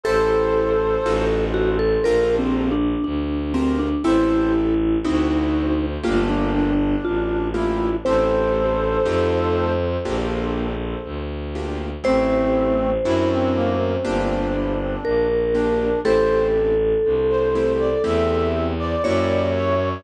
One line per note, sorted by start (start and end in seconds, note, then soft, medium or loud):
0.04 0.97 A1 medium
0.04 0.75 E4 loud
0.04 0.75 G4 loud
0.04 1.25 A4 medium
0.04 0.75 A4 loud
0.04 1.45 A4 loud
0.04 1.25 C5 loud
0.04 0.75 C5 loud
1.05 1.97 A1 loud
1.05 1.76 D#4 loud
1.05 1.76 F4 loud
1.05 1.76 F#4 loud
1.05 1.76 A4 loud
1.54 1.77 F#4 medium
1.79 2.03 A4 medium
2.04 2.95 A#1 loud
2.04 2.75 D4 loud
2.04 2.75 F4 loud
2.04 2.75 G4 loud
2.04 2.36 A#4 medium
2.04 2.75 A#4 loud
2.39 2.70 C4 medium
2.72 3.03 D4 medium
3.04 3.94 D2 medium
3.04 3.53 D4 medium
3.54 3.78 C4 medium
3.54 3.89 D4 medium
3.54 3.89 F4 medium
3.54 3.89 G4 medium
3.54 3.89 A#4 loud
3.79 4.03 D4 medium
4.04 4.96 A1 loud
4.04 4.74 C4 loud
4.04 4.74 E4 loud
4.04 4.99 E4 loud
4.04 4.74 G4 loud
4.04 4.74 A4 loud
4.04 4.53 C5 loud
5.04 5.97 D2 loud
5.04 5.74 C4 loud
5.04 5.74 D4 medium
5.04 5.86 D#4 medium
5.04 5.74 E4 loud
5.04 5.74 F#4 loud
6.03 6.95 G1 loud
6.03 6.73 A3 loud
6.03 6.73 A#3 loud
6.03 6.53 D4 medium
6.03 6.73 F4 loud
6.03 6.28 F4 medium
6.03 6.73 G4 loud
6.29 6.96 D4 medium
6.54 7.47 D4 medium
7.04 7.94 A1 medium
7.04 7.49 F4 medium
7.54 7.89 A3 medium
7.54 7.89 A#3 loud
7.54 7.96 E4 medium
7.54 7.89 F4 medium
7.54 7.97 F4 medium
7.54 7.89 G4 loud
8.05 8.98 A1 loud
8.05 8.76 A3 loud
8.05 8.76 C4 loud
8.05 8.76 E4 loud
8.05 8.76 G4 loud
8.05 9.72 A4 medium
8.05 10.17 C5 loud
8.05 9.72 C5 medium
9.05 9.97 F2 loud
9.05 9.75 A3 loud
9.05 9.75 D#4 loud
9.05 9.75 F4 loud
9.05 9.75 G4 loud
10.05 10.95 A#1 loud
10.05 10.75 A#3 loud
10.05 10.75 D4 loud
10.05 10.75 F4 loud
10.05 10.75 G4 loud
11.04 11.94 D2 medium
11.55 11.90 A#3 medium
11.55 11.90 D4 medium
11.55 11.90 F4 medium
11.55 11.90 G4 medium
12.04 12.97 A1 loud
12.04 12.74 A3 loud
12.04 12.90 A3 medium
12.04 12.74 C4 loud
12.04 12.90 C4 loud
12.04 12.74 E4 loud
12.04 12.74 G4 loud
12.04 14.95 C5 loud
13.04 13.96 F#2 loud
13.04 13.75 C4 loud
13.04 13.75 D4 loud
13.04 13.29 E4 medium
13.04 13.75 E4 loud
13.04 13.75 F#4 loud
13.31 13.55 C4 medium
13.55 13.95 A#3 loud
14.03 14.96 G1 loud
14.03 14.75 A#3 loud
14.03 15.27 D4 medium
14.03 14.75 D4 loud
14.03 14.75 F4 loud
14.03 14.75 G4 loud
15.04 15.94 A#1 medium
15.04 15.99 A#4 medium
15.55 15.90 A#3 medium
15.55 15.90 D4 medium
15.55 16.00 D4 medium
15.55 15.90 F4 medium
15.55 15.90 G4 medium
16.04 16.94 A1 loud
16.04 16.75 A3 loud
16.04 16.75 C4 loud
16.04 16.75 E4 loud
16.04 16.75 G4 loud
16.04 18.49 A4 loud
16.04 16.47 C5 loud
17.05 17.95 C2 medium
17.30 17.72 C5 medium
17.55 17.90 A3 loud
17.55 17.90 C4 medium
17.55 17.90 E4 medium
17.55 17.90 G4 medium
17.79 18.03 D5 medium
18.03 18.95 E2 loud
18.03 18.74 A3 loud
18.03 18.74 C4 loud
18.03 18.74 E4 loud
18.03 18.74 G4 loud
18.03 18.67 E5 medium
18.79 19.49 D5 medium
19.04 19.97 F#2 loud
19.04 19.75 A#3 loud
19.04 19.75 E4 loud
19.04 19.75 F#4 loud
19.04 19.75 G4 loud
19.04 19.89 C#5 medium
19.55 20.03 C#5 medium